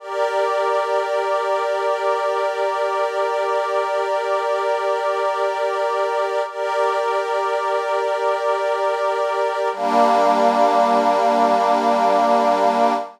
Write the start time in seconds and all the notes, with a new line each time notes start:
0.00 G4 A#4 D5
6.48 G4 A#4 D5
9.72 G3 A#3 D4